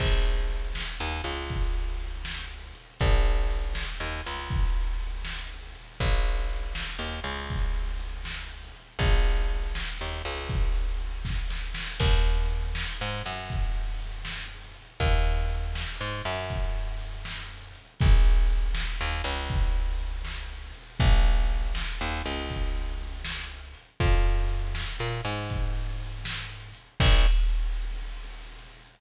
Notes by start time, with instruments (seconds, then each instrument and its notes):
0.00 electric bass (finger) A#1, kick, crash
0.50 closed hi-hat
0.75 snare
1.00 electric bass (finger) D#2
1.24 electric bass (finger) C#2, closed hi-hat
1.50 kick, closed hi-hat
2.00 closed hi-hat
2.25 snare
2.75 closed hi-hat
3.00 electric bass (finger) A#1, kick, closed hi-hat
3.50 closed hi-hat
3.75 snare
4.00 electric bass (finger) D#2
4.25 electric bass (finger) C#2, closed hi-hat
4.50 kick, closed hi-hat
5.00 closed hi-hat
5.25 snare
5.75 closed hi-hat
6.00 electric bass (finger) A#1, kick, closed hi-hat
6.50 closed hi-hat
6.75 snare
6.99 electric bass (finger) D#2
7.24 electric bass (finger) C#2, closed hi-hat
7.50 kick, closed hi-hat
8.00 closed hi-hat
8.25 snare
8.75 closed hi-hat
8.99 electric bass (finger) A#1, kick, closed hi-hat
9.50 closed hi-hat
9.75 snare
10.01 electric bass (finger) D#2
10.25 electric bass (finger) C#2, closed hi-hat
10.49 kick, closed hi-hat
11.00 closed hi-hat
11.25 kick, snare
11.50 snare
11.74 snare
12.00 electric bass (finger) D#2, kick, crash
12.50 closed hi-hat
12.75 snare
13.01 electric bass (finger) G#2
13.25 electric bass (finger) F#2, closed hi-hat
13.50 kick, closed hi-hat
14.00 closed hi-hat
14.25 snare
14.75 closed hi-hat
15.00 electric bass (finger) D#2, kick, closed hi-hat
15.50 closed hi-hat
15.75 snare
16.01 electric bass (finger) G#2
16.25 electric bass (finger) F#2, closed hi-hat
16.50 kick, closed hi-hat
17.00 closed hi-hat
17.25 snare
17.75 closed hi-hat
18.00 electric bass (finger) A#1, kick, closed hi-hat
18.50 closed hi-hat
18.75 snare
19.01 electric bass (finger) D#2
19.24 electric bass (finger) C#2, closed hi-hat
19.49 kick, closed hi-hat
20.00 closed hi-hat
20.25 snare
20.74 closed hi-hat
21.00 electric bass (finger) A#1, kick, closed hi-hat
21.50 closed hi-hat
21.75 snare
22.01 electric bass (finger) D#2
22.25 electric bass (finger) C#2, closed hi-hat
22.50 kick, closed hi-hat
23.00 closed hi-hat
23.25 snare
23.75 closed hi-hat
24.00 electric bass (finger) F2, kick, closed hi-hat
24.50 closed hi-hat
24.75 snare
25.00 electric bass (finger) A#2
25.25 electric bass (finger) G#2, closed hi-hat
25.50 kick, closed hi-hat
26.00 closed hi-hat
26.25 snare
26.75 closed hi-hat
27.00 electric bass (finger) A#1, kick, crash